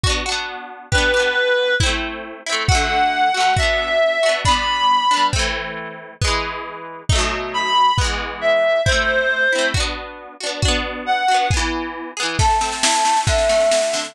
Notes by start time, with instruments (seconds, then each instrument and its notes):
0.03 acoustic guitar (steel) D4 F#4, kick
0.10 acoustic guitar (steel) B3
0.26 acoustic guitar (steel) D4 F#4
0.32 acoustic guitar (steel) B3
0.92 acoustic guitar (steel) D4 G4, clarinet B4, kick
0.98 acoustic guitar (steel) B3
1.14 acoustic guitar (steel) D4 G4
1.20 acoustic guitar (steel) B3
1.80 acoustic guitar (steel) C4 E4, kick
1.86 acoustic guitar (steel) A3
2.46 acoustic guitar (steel) C4 E4
2.52 acoustic guitar (steel) A3
2.68 acoustic guitar (steel) A3 F#4, clarinet F#5, kick
2.75 acoustic guitar (steel) D3
3.34 acoustic guitar (steel) A3 F#4
3.40 acoustic guitar (steel) D3
3.57 acoustic guitar (steel) D4 F#4, clarinet E5, kick
3.62 acoustic guitar (steel) B3
4.23 acoustic guitar (steel) D4 F#4
4.29 acoustic guitar (steel) B3
4.45 acoustic guitar (steel) B3 D4, clarinet B5, kick
4.51 acoustic guitar (steel) G3
5.11 acoustic guitar (steel) B3 D4
5.17 acoustic guitar (steel) G3
5.33 acoustic guitar (steel) A3 C4, kick
5.39 acoustic guitar (steel) E3
6.22 acoustic guitar (steel) G#3 B3, kick
6.27 acoustic guitar (steel) E3
7.09 acoustic guitar (steel) A3 D#4, kick
7.15 acoustic guitar (steel) B2 F#3
7.54 clarinet B5
7.98 acoustic guitar (steel) G#3 B3, kick
8.04 acoustic guitar (steel) E3
8.41 clarinet E5
8.85 acoustic guitar (steel) C4 E4, clarinet C5, kick
8.92 acoustic guitar (steel) A3
9.52 acoustic guitar (steel) C4 E4
9.58 acoustic guitar (steel) A3
9.74 acoustic guitar (steel) D4 F#4, kick
9.80 acoustic guitar (steel) B3
10.40 acoustic guitar (steel) D4 F#4
10.46 acoustic guitar (steel) B3
10.62 acoustic guitar (steel) D4 F#4, kick
10.68 acoustic guitar (steel) B3
11.06 clarinet F#5
11.28 acoustic guitar (steel) D4 F#4
11.34 acoustic guitar (steel) B3
11.50 acoustic guitar (steel) B3 G#4, kick
11.57 acoustic guitar (steel) E3
12.17 acoustic guitar (steel) B3 G#4
12.23 acoustic guitar (steel) E3
12.39 acoustic guitar (steel) A3, flute A5, kick, snare
12.50 snare
12.61 acoustic guitar (steel) C4, snare
12.72 snare
12.83 acoustic guitar (steel) E4, snare
12.94 snare
13.05 acoustic guitar (steel) A3, snare
13.16 snare
13.27 acoustic guitar (steel) D3, flute E5, kick, snare
13.38 snare
13.49 acoustic guitar (steel) A3, snare
13.60 snare
13.71 acoustic guitar (steel) F#4, snare
13.82 snare
13.93 acoustic guitar (steel) D3, snare
14.05 snare